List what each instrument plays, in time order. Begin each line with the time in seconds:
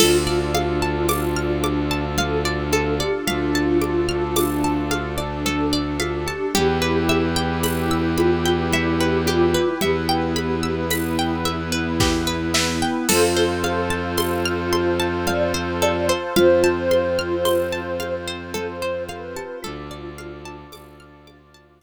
0.00 violin D2, pad 2 (warm) D4 F4 A4, ocarina D4, kalimba F4, pizzicato strings A4, crash, low conga
0.27 pizzicato strings D5
0.55 pizzicato strings F5, high conga
0.82 pizzicato strings A5
1.09 pizzicato strings D6, tambourine, high conga
1.36 pizzicato strings F6
1.64 pizzicato strings D6, high conga
1.91 pizzicato strings A5
2.18 kalimba A4, pizzicato strings F5, low conga
2.45 pizzicato strings D5
2.72 pizzicato strings A4, kalimba A4, high conga
3.00 kalimba G4, pizzicato strings D5
3.27 violin D2, pad 2 (warm) A3 D4 A4, kalimba F4, ocarina F4, pizzicato strings F5, low conga
3.55 pizzicato strings A5
3.81 pizzicato strings D6, high conga
4.09 pizzicato strings F6
4.36 pizzicato strings D6, tambourine, high conga
4.64 pizzicato strings A5
4.91 pizzicato strings F5, high conga
5.18 pizzicato strings D5
5.45 kalimba A4, pizzicato strings A4, low conga
5.73 pizzicato strings D5
6.00 kalimba F4, pizzicato strings F5, high conga
6.26 kalimba G4, pizzicato strings A5
6.54 violin E2, ocarina E3, pad 2 (warm) E4 G4 B4, kalimba G4, pizzicato strings G4, low conga
6.82 pizzicato strings B4
7.09 ocarina E3, pizzicato strings E5, high conga
7.36 pizzicato strings G5
7.63 pizzicato strings B5, tambourine, high conga
7.91 pizzicato strings E6
8.17 kalimba F4, pizzicato strings B5, high conga
8.45 pizzicato strings G5
8.72 ocarina G3, kalimba G4, pizzicato strings E5, low conga
9.00 kalimba G4, pizzicato strings B4
9.26 kalimba F4, pizzicato strings G4, high conga
9.54 pizzicato strings B4
9.81 violin E2, ocarina E3, pad 2 (warm) B3 E4 B4, kalimba G4, pizzicato strings E5, low conga
10.09 pizzicato strings G5
10.36 pizzicato strings B5, high conga
10.63 pizzicato strings E6
10.90 ocarina E4, pizzicato strings B5, tambourine, high conga
11.19 pizzicato strings G5
11.45 pizzicato strings E5, high conga
11.72 pizzicato strings B4
12.00 pizzicato strings G4, kick, snare
12.27 pizzicato strings B4
12.54 pizzicato strings E5, snare
12.82 pizzicato strings G5
13.09 violin F2, ocarina F4, pad 2 (warm) F4 A4 C5, pizzicato strings A4, kalimba A4, crash, low conga
13.37 pizzicato strings C5
13.64 pizzicato strings F5, high conga
13.90 pizzicato strings A5
14.17 pizzicato strings C6, tambourine, high conga
14.45 pizzicato strings F6
14.73 pizzicato strings C6, high conga
15.00 pizzicato strings A5
15.27 kalimba D5, pizzicato strings F5, low conga
15.54 pizzicato strings C5
15.82 pizzicato strings A4, kalimba D5, high conga
16.09 pizzicato strings C5, kalimba C5
16.36 violin F2, pad 2 (warm) C4 F4 C5, kalimba F4, ocarina C5, pizzicato strings F5, low conga
16.64 pizzicato strings A5
16.91 pizzicato strings C6, high conga
17.19 pizzicato strings F6
17.45 pizzicato strings C6, tambourine, high conga
17.72 pizzicato strings A5
18.00 pizzicato strings F5, high conga
18.27 pizzicato strings C5
18.54 pizzicato strings A4, kalimba A4, ocarina C5, low conga
18.82 pizzicato strings C5
19.08 kalimba A4, ocarina B4, pizzicato strings F5, high conga
19.36 kalimba G4, pizzicato strings A5
19.62 violin D2, ocarina D4, kalimba F4, pad 2 (warm) F4 A4 D5, pizzicato strings A4, low conga
19.91 pizzicato strings D5
20.18 pizzicato strings F5, high conga
20.45 pizzicato strings A5
20.72 violin D2, pizzicato strings D6, tambourine, high conga
21.00 pizzicato strings F6
21.27 pad 2 (warm) D4 F4 D5, pizzicato strings D6, high conga
21.54 pizzicato strings A5
21.81 pizzicato strings F5